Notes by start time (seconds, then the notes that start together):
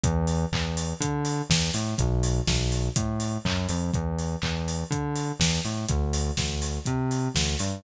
0.03 E2, kick, closed hi-hat
0.27 open hi-hat
0.52 E2, kick, clap
0.77 open hi-hat
1.00 D3, kick, closed hi-hat
1.25 open hi-hat
1.50 E2, kick, snare
1.74 A2, open hi-hat
1.98 B1, kick, closed hi-hat
2.23 open hi-hat
2.47 B1, kick, snare
2.72 open hi-hat
2.96 A2, kick, closed hi-hat
3.20 open hi-hat
3.45 F#2, kick, clap
3.69 F2, open hi-hat
3.93 E2, kick, closed hi-hat
4.18 open hi-hat
4.42 E2, kick, clap
4.68 open hi-hat
4.90 D3, kick, closed hi-hat
5.16 open hi-hat
5.39 E2, kick, snare
5.65 A2, open hi-hat
5.88 D2, kick, closed hi-hat
6.13 open hi-hat
6.37 D2, kick, snare
6.62 open hi-hat
6.85 C3, kick, closed hi-hat
7.11 open hi-hat
7.35 D2, kick, snare
7.59 G2, open hi-hat